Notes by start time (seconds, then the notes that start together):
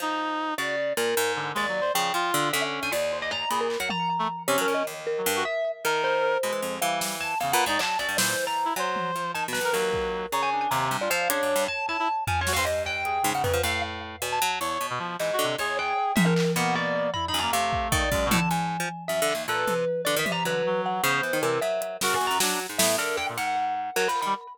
0.00 F3 D#4
0.58 C#3 F#4 D5
0.97 A#2 A#4
1.17 G#2
1.36 D3
1.55 D#2 G#3 D5
1.69 F#3
1.81 C5
1.94 C#3 F3 G5
2.14 F3 F4
2.34 D3
2.53 D3 C#4 E5
2.83 D3 G#5
2.92 D#2 D5
3.12 C5
3.22 D#5
3.31 A#5, cowbell
3.50 A#2 G#4 B5, closed hi-hat
3.61 A#4
3.70 clap
3.80 F#3 F#5
3.90 A#5, high tom
4.19 A3
4.48 C3 C#4 C#5
4.58 F#3 A#4
4.68 A#2
4.74 D#5
4.87 D#2
5.07 A#4
5.18 F#3
5.26 G2
5.36 F#4
5.45 E5
5.85 D#3 A#4
6.04 C5
6.43 B2 G#3
6.53 E3
6.62 F2
6.81 E3 G3 F5
7.01 snare
7.21 A5
7.40 E2 C#3 F5
7.52 A#2 B4 F#5
7.66 G#2 D#4 D5
7.79 F#3 A5, clap
7.99 F#2 D5
8.09 G2
8.17 A#2 E3 C5, snare
8.47 A#5
8.65 E4
8.76 F#3 C5, cowbell
8.96 high tom
9.16 F3
9.34 D#3 A5
9.48 B2
9.53 B4, snare
9.61 A2 A#4
9.73 D#2 F#3 A#4, clap
9.94 kick
10.32 C#3 C#5 A#5, cowbell
10.43 G#5
10.52 D4
10.61 G#5
10.71 D#2 C3 A#5
10.91 G2
11.01 F4 D5
11.10 F3 F5
11.29 C#3 D4 C#5, closed hi-hat
11.43 F#2
11.56 G2
11.68 A5
11.88 E4 A5
11.99 E4
12.27 F3 G#5, floor tom
12.41 C#5
12.47 F#4, snare
12.53 G2 C5 F5
12.65 G2 D#5
12.86 G5, cowbell
13.05 G#4, closed hi-hat
13.23 G#2 C#3
13.34 G#2 F#5
13.44 F2 B4, floor tom
13.53 F3
13.63 A2 F5
14.22 B2, cowbell
14.32 A5
14.42 F#3
14.60 E2 C#5
14.81 B2
14.90 B2
14.99 F3
15.19 G#2 E3 D#5, clap
15.33 F#4
15.39 D3
15.44 C3
15.58 E2 G#4 C#5
15.79 G5
16.16 G#2 E5, high tom
16.26 A#4
16.36 clap
16.56 B2 A#3 F#5
16.75 D5
17.14 E4 B5, floor tom
17.28 D#4 B5
17.34 F#2
17.39 A#3 A#5
17.51 C3 A3 F5
17.73 kick
17.92 D#3 D5, kick
18.12 F#2 G#3, kick
18.26 B2
18.31 A2 A5, high tom
18.38 D3
18.51 G#2 G#5
18.80 F3
19.08 F#2 E5
19.22 D3
19.29 clap
19.35 D#2
19.48 A#2 A4 B4
19.67 C3, high tom
20.05 D3 D5
20.16 D#3 E5
20.26 C3, high tom
20.32 A#5
20.44 D3 F#3 B4
20.66 F#3
20.86 F#5
21.02 C#3 B3 C5
21.23 E3
21.33 D#3
21.41 C3 E3 A#4, cowbell
21.61 F#3 E5
21.82 closed hi-hat
22.01 C#3 F#4 A#4, snare
22.14 G#5
22.21 E2
22.27 F#2 A#5
22.40 F#3 D4, snare
22.60 closed hi-hat
22.69 G#2
22.78 A2 B3 E5, snare
22.98 D3 A#4
23.17 G5
23.29 A#2
23.37 G#2 F#5, closed hi-hat
23.96 F#3 A#4, clap
24.08 F3 B5
24.16 clap
24.22 D#3 B5
24.26 G3